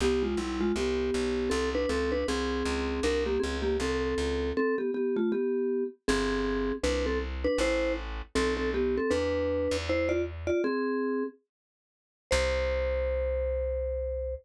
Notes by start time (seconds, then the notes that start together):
0.00 C2 B3 G4
0.23 G#3 F4
0.37 B1 G3 E4
0.61 G#3 F4
0.76 C2 B3 G4
1.14 B1
1.50 C2 C4 A4
1.75 D4 B4
1.89 C#2 C4 A4
2.12 D4 B4
2.28 C2 C4 G#4
2.65 C#2
3.03 C2 D4 A#4
3.26 A#3 G4
3.40 C#2 C4 G#4
3.62 A#3 G4
3.80 C2 C4 A4
4.18 C#2
4.57 C4 A4
4.78 B3 G4
4.94 B3 G4
5.16 A3 F4
5.32 B3 G4
6.08 G1 C4 G#4
6.83 C2 D4 B4
7.06 C4 A4
7.44 D4 B4
7.58 A1 E4 C5
8.35 B1 C4 A4
8.57 C4 A4
8.74 B3 G4
8.97 C4 A4
9.11 E2 D4 B4
9.71 E2
9.89 E4 C5
10.09 F4 D5
10.47 F4 D5
10.64 C4 G#4
12.31 C2 C5